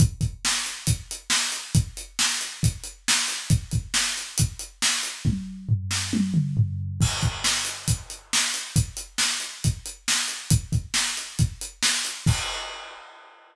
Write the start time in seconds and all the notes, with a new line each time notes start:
0.00 kick, closed hi-hat
0.21 kick, closed hi-hat
0.45 snare
0.66 closed hi-hat
0.87 kick, closed hi-hat
1.11 closed hi-hat
1.30 snare
1.52 closed hi-hat
1.75 kick, closed hi-hat
1.97 closed hi-hat
2.19 snare
2.41 closed hi-hat
2.63 kick, closed hi-hat
2.84 closed hi-hat
3.08 snare
3.28 closed hi-hat
3.50 kick, closed hi-hat
3.71 kick, closed hi-hat
3.94 snare
4.17 closed hi-hat
4.38 kick, closed hi-hat
4.59 closed hi-hat
4.82 snare
5.03 closed hi-hat
5.25 kick, high tom
5.69 floor tom
5.91 snare
6.13 high tom
6.34 mid tom
6.57 floor tom
7.01 kick, crash
7.22 kick, closed hi-hat
7.44 snare
7.65 closed hi-hat
7.88 kick, closed hi-hat
8.10 closed hi-hat
8.33 snare
8.54 closed hi-hat
8.76 kick, closed hi-hat
8.97 closed hi-hat
9.18 snare
9.40 closed hi-hat
9.64 kick, closed hi-hat
9.86 closed hi-hat
10.08 snare
10.28 closed hi-hat
10.50 kick, closed hi-hat
10.72 kick, closed hi-hat
10.94 snare
11.17 closed hi-hat
11.39 kick, closed hi-hat
11.61 closed hi-hat
11.83 snare
12.05 closed hi-hat
12.26 kick, crash